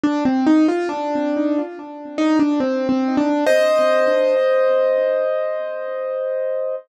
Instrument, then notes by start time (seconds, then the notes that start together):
acoustic grand piano
0.04 D4
0.25 C4
0.47 D#4
0.68 F4
0.89 D4
2.18 D#4
2.39 D4
2.60 C4
2.89 C4
3.17 D4
3.46 C5 D#5